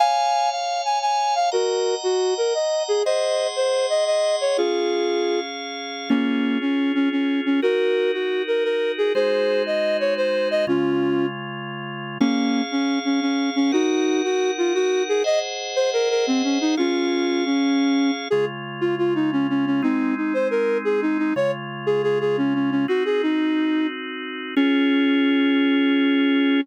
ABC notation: X:1
M:9/8
L:1/8
Q:3/8=118
K:Db
V:1 name="Flute"
[fa]3 f2 a a2 f | [GB]3 G2 B e2 A | [ce]3 c2 e e2 d | [FA]5 z4 |
[B,D]3 D2 D D2 D | [GB]3 G2 B B2 A | [Ac]3 e2 d c2 e | [DF]4 z5 |
[B,D]3 D2 D D2 D | [EG]3 G2 F G2 A | e z2 c B B C D E | [DF]4 D4 z |
A z2 F F E D D D | [CE]2 E c B2 A E E | d z2 A A A D D D | "^rit." G A E4 z3 |
D9 |]
V:2 name="Drawbar Organ"
[dfa]9 | [egb]9 | [Aegc']9 | [DAf]9 |
[DFA]9 | [EGB]9 | [A,EGc]9 | [D,A,F]9 |
[DAf]9 | [EBg]9 | [Aceg]9 | [DAf]9 |
[D,A,F]9 | [A,CE]9 | [D,A,F]9 | "^rit." [CEG]9 |
[DFA]9 |]